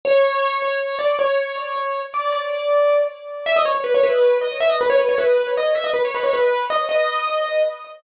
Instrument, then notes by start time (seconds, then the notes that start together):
acoustic grand piano
0.05 C#5
0.99 D5
1.19 C#5
2.14 D5
2.32 D5
3.46 E5
3.56 D#5
3.65 C#5
3.75 C#5
3.84 B4
3.94 C#5
4.03 B4
4.41 D#5
4.60 E5
4.69 D#5
4.81 B4
4.90 C#5
4.99 B4
5.09 C#5
5.18 B4
5.57 D#5
5.75 E5
5.84 D#5
5.94 B4
6.05 C#5
6.14 B4
6.23 C#5
6.33 B4
6.70 D#5
6.89 D#5